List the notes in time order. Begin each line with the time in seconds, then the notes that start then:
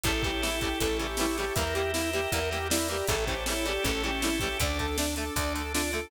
0.04 A1 C#3 E3 G3 A3 C#4 E4 G4 A4 C#5 E5 G5 A5, kick, closed hi-hat
0.23 C#3 E3 G3 A3 G4, kick, closed hi-hat
0.42 C#3 E3 G3 A3 E4, snare
0.61 C#3 E3 G3 A3 G4, kick, closed hi-hat
0.80 A1 C#3 E3 G3 A3 A4 C#5 E5 A5 C#6, kick, closed hi-hat
0.99 C#3 E3 G3 A3 G4, closed hi-hat
1.17 C#3 E3 G3 A3 E4 G4, snare
1.38 C#3 E3 G3 A3 G4, closed hi-hat
1.55 E2 E3 G3 A#3 E4 G4 A#4 E5 G5 A#5, kick, closed hi-hat
1.74 E3 G3 A#3 G4, closed hi-hat
1.93 E3 G3 A#3 E4, snare
2.13 E3 G3 A#3 G4, closed hi-hat
2.32 E2 E3 G3 A#3 A#4 E5 A#5, kick, closed hi-hat
2.50 E3 G3 A#3 G4, closed hi-hat
2.70 E3 G3 A#3 E4 D5, snare
2.88 E3 G3 A#3 G4, closed hi-hat
3.07 A1 C#3 E3 G3 A3 C#4 E4 G4 A4 C#5 E5 G5 A5, kick, closed hi-hat
3.27 C#3 E3 G3 A3 G4 C5, kick, closed hi-hat
3.46 C#3 E3 G3 A3 E4 C#5, snare
3.65 C#3 E3 G3 A3 G4 D5, closed hi-hat
3.83 A1 C#3 E3 G3 A3 C#4 A4 C#5 E5 A5 C#6, kick, closed hi-hat
4.03 C#3 E3 G3 A3 G4, closed hi-hat
4.22 C#3 E3 G3 A3 E4, snare
4.40 C#3 E3 G3 A3 G4, kick, closed hi-hat
4.58 D2 D3 A3 D4 A4 D5, kick, closed hi-hat
4.79 D3 A3 A4, kick, closed hi-hat
4.97 D3 A3 D4, snare
5.16 D3 A3 A4, closed hi-hat
5.36 D2 D3 A3 D5, kick, closed hi-hat
5.55 D3 A3 A4, closed hi-hat
5.74 D3 A3 D4 F4, snare
5.92 D3 A3 A4, closed hi-hat